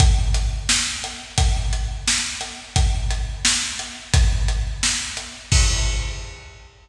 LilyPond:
\new DrumStaff \drummode { \time 2/2 \tempo 2 = 87 <hh bd>4 hh4 sn4 hh4 | <hh bd>4 hh4 sn4 hh4 | <hh bd>4 hh4 sn4 hh4 | <hh bd>4 hh4 sn4 hh4 |
<cymc bd>2 r2 | }